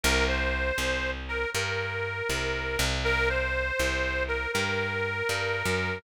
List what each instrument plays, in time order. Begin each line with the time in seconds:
0.03 electric bass (finger) C2, harmonica A#4
0.28 harmonica C5
0.78 electric bass (finger) C2
1.28 harmonica A#4
1.54 electric bass (finger) G2, harmonica A#4
2.29 electric bass (finger) C2
2.79 electric bass (finger) C2
3.04 harmonica A#4
3.29 harmonica C5
3.79 electric bass (finger) C2
4.28 harmonica A#4
4.53 electric bass (finger) G2, harmonica A#4
5.29 electric bass (finger) G2
5.65 electric bass (finger) F#2